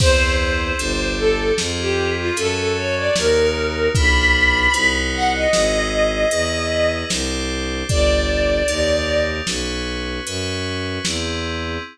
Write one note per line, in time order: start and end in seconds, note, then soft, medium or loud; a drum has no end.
0.00 0.73 E2 medium
0.00 0.78 C4 loud
0.00 0.78 E4 loud
0.00 0.78 G#4 loud
0.00 0.35 C5 loud
0.00 kick loud
0.00 crash loud
0.39 1.07 C5 medium
0.79 1.52 G1 medium
0.79 1.57 D4 loud
0.79 1.57 G4 loud
0.79 1.57 A4 medium
0.79 closed hi-hat loud
1.18 1.52 A4 loud
1.58 2.31 F2 medium
1.58 2.35 C4 loud
1.58 2.35 F4 medium
1.58 2.35 G#4 loud
1.58 snare loud
1.78 2.13 G4 loud
2.17 2.36 F4 loud
2.36 3.09 F#2 medium
2.36 3.14 C#4 loud
2.36 3.14 F#4 medium
2.36 3.14 A4 loud
2.36 2.56 A4 loud
2.36 closed hi-hat loud
2.57 2.75 A4 loud
2.76 2.95 C#5 loud
2.96 3.15 D5 loud
3.15 3.89 D#2 medium
3.15 3.93 D#4 loud
3.15 3.93 F#4 medium
3.15 3.93 A#4 medium
3.15 3.87 A#4 loud
3.15 snare loud
3.95 4.67 B1 medium
3.95 4.72 D4 loud
3.95 4.72 F4 loud
3.95 4.72 B4 medium
3.95 4.91 B5 loud
3.95 kick loud
3.95 closed hi-hat loud
4.73 5.46 C2 medium
4.73 5.50 D#4 medium
4.73 5.50 F#4 loud
4.73 5.50 C5 loud
4.73 closed hi-hat loud
5.13 5.32 F#5 loud
5.33 6.96 D#5 loud
5.53 6.25 G#1 medium
5.53 6.31 E4 loud
5.53 6.31 G#4 loud
5.53 6.31 C5 medium
5.53 snare loud
6.31 7.04 E2 medium
6.31 7.09 E4 medium
6.31 7.09 G#4 loud
6.31 7.09 B4 loud
6.31 closed hi-hat loud
7.10 7.83 C2 medium
7.10 7.87 D4 loud
7.10 7.87 G4 loud
7.10 7.87 C5 loud
7.10 snare loud
7.89 8.62 G1 medium
7.89 8.67 D4 loud
7.89 8.67 G4 medium
7.89 8.67 A4 loud
7.89 9.22 D5 loud
7.89 kick loud
7.89 closed hi-hat loud
8.68 9.41 D#2 medium
8.68 9.46 D#4 medium
8.68 9.46 G4 loud
8.68 9.46 A#4 medium
8.68 closed hi-hat loud
9.47 10.20 B1 medium
9.47 10.25 C#4 medium
9.47 10.25 F#4 medium
9.47 10.25 B4 medium
9.47 snare loud
10.26 10.99 F#2 medium
10.26 11.04 C#4 medium
10.26 11.04 F#4 medium
10.26 11.04 B4 loud
10.26 closed hi-hat loud
11.05 11.78 E2 medium
11.05 11.83 C4 loud
11.05 11.83 E4 medium
11.05 11.83 G#4 medium
11.05 snare loud